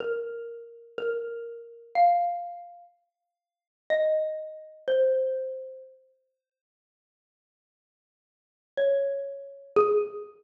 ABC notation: X:1
M:2/4
L:1/8
Q:1/4=123
K:Ab
V:1 name="Xylophone"
B4 | B4 | f4 | z4 |
e4 | c4 | z4 | z4 |
z4 | d4 | A2 z2 |]